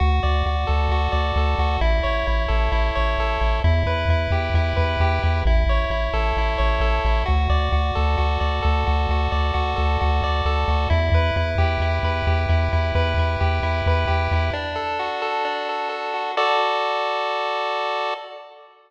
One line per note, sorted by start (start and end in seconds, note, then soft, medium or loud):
0.00 0.20 D2 loud
0.00 0.46 F#4 medium
0.23 0.43 D2 medium
0.23 1.11 D5 medium
0.46 0.65 D2 medium
0.46 0.91 F#4 medium
0.67 0.88 D2 medium
0.67 1.37 A4 medium
0.89 1.09 D2 medium
0.89 1.59 F#4 medium
1.12 1.32 D2 medium
1.12 1.77 D5 medium
1.36 1.55 D2 loud
1.36 1.80 A4 medium
1.59 1.78 D2 medium
1.59 1.81 F#4 medium
1.81 2.01 A1 loud
1.81 2.27 E4 medium
2.03 2.24 A1 medium
2.03 2.95 C#5 medium
2.27 2.47 A1 medium
2.27 2.71 E4 medium
2.48 2.69 A1 loud
2.48 3.19 A4 medium
2.72 2.91 A1 medium
2.72 3.40 E4 medium
2.95 3.16 A1 medium
2.95 3.60 C#5 medium
3.18 3.38 A1 medium
3.18 3.63 A4 medium
3.41 3.61 A1 medium
3.41 3.62 E4 medium
3.64 3.84 E2 loud
3.64 4.09 E4 medium
3.86 4.05 E2 loud
3.86 4.76 B4 medium
4.09 4.28 E2 medium
4.09 4.55 E4 medium
4.31 4.50 E2 loud
4.31 5.00 G4 medium
4.54 4.74 E2 loud
4.54 5.23 E4 medium
4.77 4.97 E2 loud
4.77 5.41 B4 medium
5.00 5.20 E2 medium
5.00 5.44 G4 medium
5.23 5.43 E2 loud
5.23 5.45 E4 medium
5.45 5.65 A1 loud
5.45 5.90 E4 medium
5.66 5.86 A1 medium
5.66 6.57 C#5 medium
5.90 6.09 A1 medium
5.90 6.37 E4 medium
6.13 6.33 A1 loud
6.13 6.81 A4 medium
6.37 6.56 A1 medium
6.37 7.05 E4 medium
6.58 6.79 A1 medium
6.58 7.23 C#5 medium
6.80 7.00 A1 loud
6.80 7.24 A4 medium
7.05 7.24 A1 loud
7.05 7.27 E4 medium
7.26 7.48 D2 loud
7.26 7.72 F#4 medium
7.50 7.69 D2 loud
7.50 8.40 D5 medium
7.72 7.92 D2 medium
7.72 8.17 F#4 medium
7.95 8.16 D2 loud
7.95 8.62 A4 medium
8.18 8.38 D2 medium
8.18 8.86 F#4 medium
8.40 8.60 D2 medium
8.40 9.31 D5 medium
8.62 8.84 D2 loud
8.62 9.76 A4 medium
8.87 9.07 D2 medium
8.87 9.10 F#4 medium
9.09 9.28 D2 loud
9.09 9.53 F#4 medium
9.32 9.52 D2 medium
9.32 10.23 D5 medium
9.54 9.74 D2 medium
9.54 10.00 F#4 medium
9.76 9.98 D2 loud
9.76 10.45 A4 medium
10.01 10.21 D2 loud
10.01 10.68 F#4 medium
10.22 10.42 D2 medium
10.22 10.88 D5 medium
10.45 10.65 D2 medium
10.45 10.89 A4 medium
10.68 10.87 D2 loud
10.68 10.90 F#4 medium
10.90 11.10 E2 loud
10.90 11.36 E4 medium
11.12 11.31 E2 loud
11.12 12.04 B4 medium
11.36 11.56 E2 loud
11.36 11.81 E4 medium
11.58 11.78 E2 loud
11.58 12.27 G4 medium
11.80 11.99 E2 medium
11.80 12.49 E4 medium
12.03 12.22 E2 loud
12.03 12.95 B4 medium
12.27 12.46 E2 loud
12.27 13.40 G4 medium
12.49 12.69 E2 loud
12.49 12.72 E4 medium
12.73 12.92 E2 medium
12.73 13.19 E4 medium
12.95 13.14 E2 loud
12.95 13.87 B4 medium
13.18 13.37 E2 medium
13.18 13.63 E4 medium
13.40 13.61 E2 loud
13.40 14.07 G4 medium
13.63 13.82 E2 medium
13.63 14.32 E4 medium
13.86 14.06 E2 loud
13.86 14.52 B4 medium
14.07 14.28 E2 medium
14.07 14.51 G4 medium
14.31 14.51 E2 medium
14.31 14.54 E4 medium
14.53 15.44 D4 medium
14.76 15.21 A4 medium
14.99 16.13 F#4 medium
15.22 15.68 A4 medium
15.45 16.31 D4 medium
15.69 15.89 A4 medium
15.89 16.32 A4 medium
16.14 16.35 F#4 medium
16.37 18.14 F#4 medium
16.37 18.14 A4 loud
16.37 18.14 D5 loud